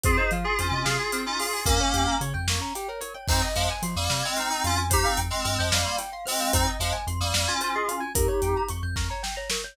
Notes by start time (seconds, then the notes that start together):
0.03 F2 C4 F4 G#4 C5, kick, closed hi-hat
0.17 D#4 G#4 C5 D#5
0.31 F3 F4 F5, closed hi-hat
0.44 F4 G#4 G#5
0.58 F2 C#4 F4 C5 C6, closed hi-hat
0.71 C3 C#4 F4 D#5 D#6
0.85 C3 F4 G#4 F5 F6, snare
0.99 G#5 G#6
1.12 C4 F6, closed hi-hat
1.26 C#4 D#4 F4 D#6
1.39 F4 G#4 C6, open hi-hat
1.53 G#4 G#5
1.65 F2 A#3 C#4 A#4, kick, closed hi-hat
1.80 C#4 C#5
1.94 F2 G4 G5, closed hi-hat
2.07 A#4 A#5
2.21 C#3 C#5 C#6, closed hi-hat
2.34 F2 G5 G6
2.47 F2 A#3 C#6, snare
2.60 C#4 A#5
2.75 G4 G5, closed hi-hat
2.88 A#4 C#5
3.01 A#4 C#5, closed hi-hat
3.14 C#5 G5
3.28 F2 C4 D#4 C5, kick, crash
3.42 D#5
3.55 F2 F3 G#3 F5, closed hi-hat
3.69 G#5
3.82 F3 C6, closed hi-hat
3.96 F2 G3 A#3 D#6
4.09 C3 G3 A#3 F6, snare
4.23 G#3 C4 G#6
4.37 C4 D#4 C5 F6, closed hi-hat
4.50 C4 D#4 D#5 D#6
4.64 F2 C#4 F4 F5 C6, closed hi-hat
4.77 G#5
4.90 D#4 G4 C5, kick, closed hi-hat
5.03 C4 D#4 F5
5.17 F2 G5, closed hi-hat
5.30 G#3 C4 C6
5.44 G2 G#3 C4 F6, closed hi-hat
5.59 F2 F3 G#3 G6
5.72 F2 G3 A#3 C5 F6, snare
5.85 F5 C6
5.98 G5, closed hi-hat
6.12 F5 C6
6.25 G#3 C4 C5 F6, open hi-hat
6.40 F5 G6
6.53 F2 C4 D#4 C5, kick, closed hi-hat
6.67 D#5
6.80 F2 F3 G#3 F5, closed hi-hat
6.93 G#5
7.07 F2 C6, closed hi-hat
7.20 F2 G3 A#3 D#6
7.34 F2 G3 A#3 F6, snare
7.47 C#4 F4 G#6
7.61 C#4 F4 C5 F6, closed hi-hat
7.75 F4 G#4 D#5 D#6
7.88 C#4 F4 F5 C6, closed hi-hat
8.00 G#5
8.15 F2 D#4 G4 A#4, kick, closed hi-hat
8.28 C#5
8.42 F2 G5, closed hi-hat
8.56 A#5
8.68 F2 C#6, closed hi-hat
8.83 F2 G6
8.96 F2 A#4 C#6, kick, snare
9.10 C#5 A#5
9.23 G5, snare
9.36 C#5 A#5
9.50 A#4 C#6, snare
9.64 C#5 G6